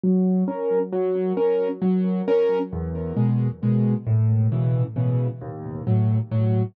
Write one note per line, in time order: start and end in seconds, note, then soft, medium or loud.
0.04 0.44 F#3 medium
0.48 0.79 C#4 medium
0.48 0.79 A#4 medium
0.92 1.33 F#3 loud
1.37 1.68 C#4 medium
1.37 1.68 A#4 medium
1.82 2.22 F#3 medium
2.28 2.59 C#4 medium
2.28 2.59 A#4 medium
2.73 3.13 E2 loud
3.17 3.48 B2 medium
3.17 3.48 G#3 medium
3.63 3.94 B2 medium
3.63 3.94 G#3 medium
4.07 4.47 A2 medium
4.52 4.83 B2 medium
4.52 4.83 C#3 medium
4.52 4.83 E3 medium
4.96 5.27 B2 medium
4.96 5.27 C#3 medium
4.96 5.27 E3 medium
5.41 5.82 D#2 loud
5.87 6.18 A2 medium
5.87 6.18 F#3 medium
6.31 6.63 A2 medium
6.31 6.63 F#3 medium